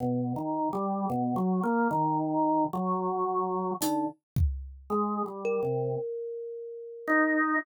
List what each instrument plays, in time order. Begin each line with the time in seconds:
0.00 drawbar organ B2
0.36 drawbar organ D#3
0.73 drawbar organ G3
1.10 drawbar organ B2
1.36 drawbar organ F#3
1.63 drawbar organ A#3
1.91 drawbar organ D#3
2.73 drawbar organ F#3
3.81 drawbar organ D3, kalimba D#4, closed hi-hat
4.36 kick
4.90 drawbar organ G#3
5.26 drawbar organ G3
5.45 kalimba A#4
5.63 drawbar organ C3
7.07 drawbar organ D#4